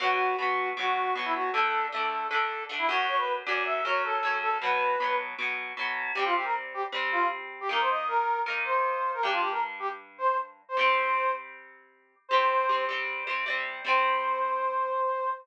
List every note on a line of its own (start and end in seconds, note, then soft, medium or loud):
0.00 0.35 B2 loud
0.00 0.35 F#3 medium
0.00 0.35 B3 loud
0.00 0.36 F#4 loud
0.37 0.73 B2 medium
0.37 0.73 F#3 medium
0.37 0.69 F#4 loud
0.42 0.73 B3 medium
0.77 1.11 B2 medium
0.77 1.11 F#3 medium
0.77 1.11 B3 medium
0.77 1.14 F#4 loud
1.15 1.50 B2 medium
1.15 1.50 F#3 medium
1.15 1.50 B3 medium
1.25 1.34 E4 loud
1.35 1.50 F#4 medium
1.53 1.88 D3 medium
1.53 1.88 A3 medium
1.53 1.86 A4 loud
1.58 1.88 D4 medium
1.92 2.27 D3 medium
1.92 2.27 A3 medium
1.92 2.27 D4 medium
1.92 2.27 A4 loud
2.30 2.65 D3 medium
2.30 2.65 A3 medium
2.30 2.64 A4 loud
2.34 2.65 D4 medium
2.69 2.88 D3 medium
2.69 2.88 A3 medium
2.69 2.88 D4 medium
2.79 2.88 E4 loud
2.89 3.42 F#2 loud
2.89 3.42 F#3 loud
2.89 3.42 C#4 loud
2.89 3.06 F#4 loud
3.08 3.17 C#5 loud
3.17 3.33 B4 loud
3.46 3.81 F#2 medium
3.46 3.81 F#3 medium
3.46 3.55 D5 loud
3.50 3.81 C#4 medium
3.55 3.64 D5 loud
3.65 3.84 E5 loud
3.85 4.19 F#2 medium
3.85 4.19 F#3 medium
3.85 4.19 C#4 medium
3.85 4.03 C#5 loud
4.04 4.38 A4 loud
4.23 4.57 F#2 medium
4.23 4.57 F#3 medium
4.23 4.57 C#4 medium
4.42 4.58 A4 loud
4.62 4.96 B2 medium
4.62 4.96 F#3 medium
4.62 4.96 B3 medium
4.62 5.15 B4 loud
5.00 5.35 B2 medium
5.00 5.35 F#3 medium
5.00 5.35 B3 medium
5.38 5.73 B2 medium
5.38 5.73 F#3 medium
5.38 5.73 B3 medium
5.77 6.12 B2 medium
5.77 6.12 F#3 medium
5.77 6.12 B3 medium
6.15 6.85 C3 medium
6.15 6.85 G3 medium
6.15 6.24 G4 loud
6.19 6.85 C4 medium
6.25 6.34 F4 loud
6.35 6.44 G4 loud
6.44 6.53 A#4 loud
6.74 6.83 G4 loud
6.92 7.62 C3 medium
6.92 7.62 G3 medium
6.92 7.62 C4 medium
7.12 7.28 F4 loud
7.61 7.70 G4 loud
7.69 8.38 D#3 medium
7.69 8.38 A#3 loud
7.69 8.38 D#4 loud
7.69 7.81 A#4 loud
7.80 7.90 C5 loud
7.90 8.07 D#5 loud
8.07 8.40 A#4 loud
8.46 9.15 D#3 medium
8.46 9.15 A#3 medium
8.46 9.15 D#4 medium
8.65 9.11 C5 medium
9.14 9.23 A#4 loud
9.23 10.62 G2 medium
9.23 10.62 G3 medium
9.23 10.62 D4 medium
9.23 9.32 G4 loud
9.32 9.41 F4 loud
9.41 9.50 G4 loud
9.51 9.60 A#4 loud
9.80 9.89 G4 loud
10.18 10.37 C5 loud
10.69 10.77 C5 loud
10.77 12.15 C3 medium
10.77 12.15 G3 medium
10.77 12.15 C4 medium
10.77 11.31 C5 loud
12.29 12.66 C3 loud
12.29 12.85 C5 loud
12.33 12.66 G3 medium
12.33 12.66 C4 medium
12.69 12.87 C3 medium
12.69 12.87 G3 medium
12.69 12.87 C4 medium
12.89 13.24 C3 medium
12.89 13.24 G3 medium
12.89 13.24 C4 medium
13.27 13.45 C3 medium
13.27 13.45 G3 medium
13.27 13.45 C4 medium
13.46 13.81 C3 medium
13.46 13.81 G3 medium
13.46 13.81 C4 medium
13.85 15.29 C3 medium
13.85 15.29 G3 medium
13.85 15.29 C4 loud
13.85 15.30 C5 loud